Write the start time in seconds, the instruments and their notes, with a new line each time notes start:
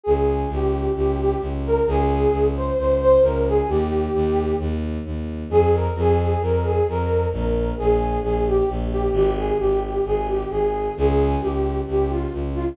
0.03 violin C#2, flute G#4
0.49 violin C#2, flute G4
0.95 violin C#2, flute G4
1.18 flute G4
1.41 violin C#2
1.65 flute A#4
1.87 violin C#2, flute G#4
2.32 violin C#2
2.55 flute C5
2.77 violin C#2, flute C5
3.00 flute C5
3.21 violin C#2, flute A#4
3.46 flute G#4
3.68 violin D#2, flute G4
4.14 violin D#2
4.59 violin D#2
5.05 violin D#2
5.49 violin F2, flute G#4
5.73 flute A#4
5.95 violin F2, flute G#4
6.18 flute G#4
6.41 violin F2, flute A#4
6.63 flute G#4
6.88 violin F2, flute A#4
7.32 violin A#1, flute A#4
7.77 violin A#1, flute G#4
8.22 violin A#1, flute G#4
8.46 flute G4
8.69 violin A#1
8.91 flute G4
9.13 violin G#1, flute G4
9.36 flute G#4
9.58 violin G#1, flute G4
9.83 flute G4
10.05 violin G#1, flute G#4
10.27 flute G4
10.49 violin G#1, flute G#4
10.96 violin C#2, flute G#4
11.40 violin C#2, flute G4
11.87 violin C#2, flute G4
12.10 flute F4
12.33 violin C#2
12.54 flute F4